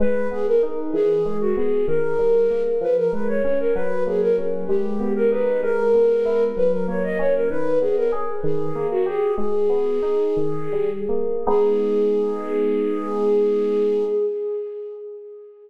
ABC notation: X:1
M:6/8
L:1/16
Q:3/8=64
K:G#m
V:1 name="Flute"
B2 G A z2 G3 F G2 | A6 B A B c c A | B2 G A z2 =G3 A B2 | A6 B A c d c A |
B2 G A z2 G3 F G2 | "^rit." G10 z2 | G12 |]
V:2 name="Electric Piano 2"
G,2 B,2 D2 E,2 G,2 B,2 | D,2 =G,2 A,2 ^E,2 ^G,2 C2 | F,2 A,2 C2 G,2 B,2 D2 | G,2 B,2 E2 F,2 A,2 C2 |
D,2 B,2 G2 D,2 A,2 =G2 | "^rit." G,2 B,2 D2 D,2 =G,2 A,2 | [G,B,D]12 |]